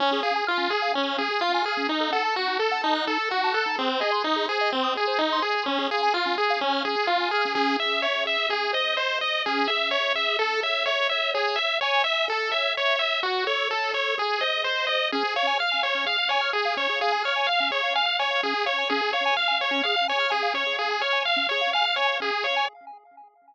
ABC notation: X:1
M:4/4
L:1/16
Q:1/4=127
K:Db
V:1 name="Lead 1 (square)"
D2 A2 F2 A2 D2 A2 F2 A2 | E2 =A2 G2 A2 E2 A2 G2 A2 | C2 A2 E2 A2 C2 A2 E2 A2 | D2 A2 F2 A2 D2 A2 F2 A2 |
[K:C#m] G2 e2 c2 e2 G2 d2 ^B2 d2 | G2 e2 c2 e2 A2 e2 c2 e2 | G2 e2 c2 e2 A2 e2 c2 e2 | F2 c2 A2 c2 G2 d2 ^B2 d2 |
[K:Db] A2 d2 f2 d2 f2 d2 A2 d2 | A2 d2 f2 d2 f2 d2 A2 d2 | A2 d2 f2 d2 f2 d2 A2 d2 | A2 d2 f2 d2 f2 d2 A2 d2 |]
V:2 name="Lead 1 (square)"
D A f a f' D A f a f' D A f a f' D | E =A g =a g' E A g a g' E A g a g' E | A c e c' e' A c e c' e' A c e c' e' A | D A f a f' D A f a f' D A f a f' D |
[K:C#m] C2 G2 e2 G2 G2 ^B2 d2 B2 | C2 G2 e2 G2 A2 c2 e2 c2 | c2 e2 g2 e2 A2 c2 e2 c2 | F2 A2 c2 A2 G2 ^B2 d2 B2 |
[K:Db] D A f a f' a f D A f a f' a f D A | f a f' a f D A f a f' a f D A f a | D A f a f' a f D A f a f' a f D A | f a f' a f D A f a f' a f D A f a |]